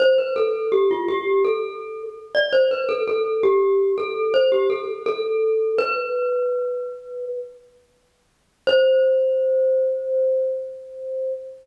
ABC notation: X:1
M:4/4
L:1/16
Q:1/4=83
K:C
V:1 name="Glockenspiel"
c B A2 G F G2 A4 z d c B | A A2 G3 A2 c G A z A4 | B10 z6 | c16 |]